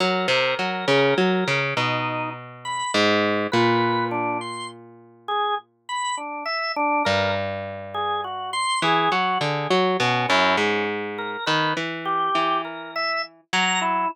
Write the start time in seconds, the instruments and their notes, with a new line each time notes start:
0.00 pizzicato strings F#3, drawbar organ A#4
0.28 pizzicato strings C3
0.59 pizzicato strings F#3
0.88 pizzicato strings C#3
1.18 pizzicato strings F#3
1.48 pizzicato strings C#3
1.77 pizzicato strings B2, drawbar organ D#4
2.65 drawbar organ B5
2.94 pizzicato strings G#2
3.52 pizzicato strings A#2, drawbar organ B4
4.11 drawbar organ D4
4.41 drawbar organ C6
5.28 drawbar organ G#4
5.89 drawbar organ B5
6.17 drawbar organ D4
6.46 drawbar organ E5
6.76 drawbar organ D4
7.05 pizzicato strings G2, drawbar organ A#4
7.94 drawbar organ G#4
8.24 drawbar organ F#4
8.53 drawbar organ C6
8.82 pizzicato strings E3, drawbar organ G#4
9.12 pizzicato strings F#3, drawbar organ F#4
9.41 pizzicato strings D3, drawbar organ G#4
9.71 pizzicato strings F#3
10.00 pizzicato strings B2, drawbar organ C#4
10.29 pizzicato strings F#2, drawbar organ E4
10.57 pizzicato strings G#2, drawbar organ C#4
11.18 drawbar organ A#4
11.46 pizzicato strings D#3, drawbar organ B4
11.77 pizzicato strings E3
12.05 drawbar organ G4
12.35 pizzicato strings E3
12.65 drawbar organ A#4
12.96 drawbar organ E5
13.53 pizzicato strings F#3, drawbar organ A#5
13.81 drawbar organ E4